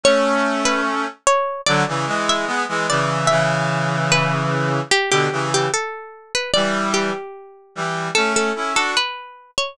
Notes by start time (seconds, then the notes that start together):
0.04 A3 C#4 C#5
0.65 B4
1.27 C#5
1.66 D3 F#3 D5
1.88 C#3 E3
2.07 E3 G#3
2.29 E5
2.47 G#3 B3
2.68 E3 G#3
2.89 C#3 E3 D5
3.27 C#3 E3 E5
4.12 B4
4.91 G4
5.11 B2 D3 G4
5.32 C#3 E3
5.54 G4
5.74 A4
6.35 B4
6.54 E3 G3 D5
6.94 G4
7.75 E3 G3
8.15 A3 C#4 A4
8.36 A4
8.55 C#4 E4
8.74 D4 F#4 A4
8.97 B4
9.58 C#5